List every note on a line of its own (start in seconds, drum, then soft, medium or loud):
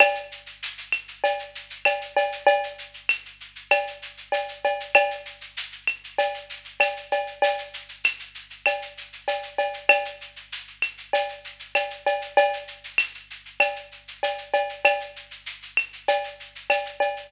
0.00 cowbell loud
0.00 claves loud
0.00 shaker loud
0.15 shaker medium
0.32 shaker medium
0.46 shaker medium
0.63 shaker loud
0.78 shaker medium
0.92 claves medium
0.92 shaker medium
1.08 shaker medium
1.24 cowbell medium
1.24 shaker loud
1.39 shaker medium
1.55 shaker medium
1.70 shaker medium
1.85 cowbell medium
1.85 claves loud
1.85 shaker loud
2.01 shaker medium
2.16 cowbell medium
2.16 shaker medium
2.32 shaker medium
2.47 cowbell loud
2.47 shaker loud
2.63 shaker medium
2.78 shaker medium
2.94 shaker medium
3.09 claves loud
3.09 shaker loud
3.26 shaker medium
3.40 shaker medium
3.56 shaker medium
3.71 cowbell medium
3.71 claves loud
3.71 shaker loud
3.87 shaker medium
4.02 shaker medium
4.17 shaker medium
4.32 cowbell medium
4.32 shaker loud
4.48 shaker medium
4.64 cowbell medium
4.64 shaker medium
4.80 shaker medium
4.95 cowbell loud
4.95 claves loud
4.95 shaker loud
5.11 shaker medium
5.25 shaker medium
5.41 shaker medium
5.57 shaker loud
5.72 shaker medium
5.87 claves medium
5.87 shaker medium
6.04 shaker medium
6.18 cowbell medium
6.18 shaker loud
6.34 shaker medium
6.50 shaker loud
6.64 shaker medium
6.80 cowbell medium
6.80 claves loud
6.80 shaker loud
6.97 shaker medium
7.12 cowbell medium
7.12 shaker medium
7.27 shaker medium
7.42 cowbell loud
7.42 shaker loud
7.58 shaker medium
7.74 shaker loud
7.89 shaker medium
8.04 claves loud
8.04 shaker loud
8.19 shaker medium
8.35 shaker medium
8.50 shaker medium
8.66 cowbell medium
8.66 claves loud
8.66 shaker loud
8.82 shaker medium
8.97 shaker medium
9.13 shaker medium
9.28 cowbell medium
9.28 shaker loud
9.43 shaker medium
9.58 cowbell medium
9.58 shaker medium
9.73 shaker medium
9.89 cowbell loud
9.89 claves loud
9.89 shaker loud
10.05 shaker medium
10.21 shaker medium
10.36 shaker medium
10.52 shaker loud
10.67 shaker medium
10.82 claves medium
10.82 shaker medium
10.98 shaker medium
11.13 cowbell medium
11.13 shaker loud
11.29 shaker medium
11.44 shaker medium
11.59 shaker medium
11.75 cowbell medium
11.75 claves medium
11.75 shaker loud
11.90 shaker medium
12.06 cowbell medium
12.06 shaker medium
12.21 shaker medium
12.37 cowbell loud
12.37 shaker loud
12.53 shaker medium
12.68 shaker medium
12.84 shaker medium
12.98 claves loud
12.98 shaker loud
13.14 shaker medium
13.30 shaker medium
13.45 shaker medium
13.60 cowbell medium
13.60 claves loud
13.60 shaker loud
13.76 shaker medium
13.92 shaker medium
14.08 shaker medium
14.23 cowbell medium
14.23 shaker loud
14.38 shaker medium
14.53 cowbell medium
14.53 shaker medium
14.69 shaker medium
14.85 cowbell loud
14.85 claves loud
14.85 shaker loud
15.00 shaker medium
15.16 shaker medium
15.31 shaker medium
15.46 shaker loud
15.62 shaker medium
15.77 claves loud
15.77 shaker medium
15.93 shaker medium
16.08 cowbell medium
16.08 shaker loud
16.24 shaker medium
16.40 shaker medium
16.55 shaker medium
16.70 cowbell medium
16.70 claves medium
16.70 shaker loud
16.85 shaker medium
17.00 cowbell medium
17.00 shaker medium
17.16 shaker medium